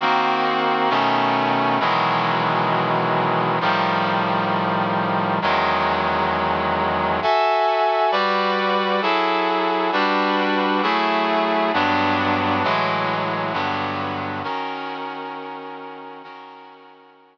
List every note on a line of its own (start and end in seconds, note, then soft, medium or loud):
0.01 0.89 D#3 medium
0.01 0.90 A#3 medium
0.01 0.90 C4 medium
0.01 0.90 F#4 medium
0.90 1.79 B2 medium
0.90 1.79 D#3 medium
0.90 1.79 A3 medium
0.90 1.79 C#4 medium
1.80 3.59 B2 medium
1.80 3.59 D#3 medium
1.80 3.59 E3 medium
1.80 3.59 F#3 medium
1.80 3.59 G#3 medium
3.61 5.39 A2 medium
3.61 5.39 D#3 medium
3.61 5.39 F3 medium
3.61 5.39 G3 medium
5.42 7.20 E2 medium
5.42 7.20 D#3 medium
5.42 7.20 F#3 medium
5.42 7.20 G#3 medium
7.22 8.11 F#4 medium
7.22 8.11 A4 medium
7.22 8.11 E5 medium
7.22 8.11 G#5 medium
8.11 9.01 G3 medium
8.11 9.01 F#4 medium
8.11 9.01 B4 medium
8.11 9.01 D5 medium
9.02 9.91 F#3 medium
9.02 9.91 E4 medium
9.02 9.91 G#4 medium
9.02 9.91 A4 medium
9.92 10.81 G3 medium
9.92 10.81 D4 medium
9.92 10.81 F#4 medium
9.92 10.81 B4 medium
10.83 11.72 F#3 medium
10.83 11.72 A3 medium
10.83 11.72 E4 medium
10.83 11.72 G#4 medium
11.73 12.63 G2 medium
11.73 12.63 F#3 medium
11.73 12.63 B3 medium
11.73 12.63 D4 medium
12.63 13.53 A2 medium
12.63 13.53 E3 medium
12.63 13.53 F#3 medium
12.63 13.53 G#3 medium
13.53 14.42 G2 loud
13.53 14.42 D3 medium
13.53 14.42 F#3 medium
13.53 14.42 B3 medium
14.44 16.22 D#3 medium
14.44 16.22 C#4 medium
14.44 16.22 F#4 medium
14.44 16.22 A#4 medium
16.23 17.38 D#3 medium
16.23 17.38 C#4 medium
16.23 17.38 F#4 medium
16.23 17.38 A#4 medium